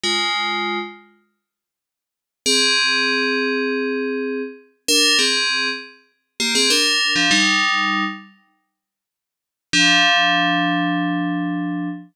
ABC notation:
X:1
M:4/4
L:1/16
Q:1/4=99
K:Fdor
V:1 name="Tubular Bells"
[A,F]6 z10 | [CA]16 | [DB]2 [CA]4 z4 [B,G] [CA] [DB]3 [F,D] | [G,E]6 z10 |
[F,D]16 |]